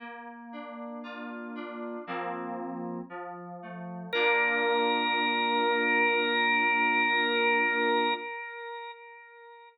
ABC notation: X:1
M:4/4
L:1/8
Q:1/4=58
K:Bb
V:1 name="Drawbar Organ"
z8 | B8 |]
V:2 name="Electric Piano 2"
B, D F D [F,B,C]2 F, A, | [B,DF]8 |]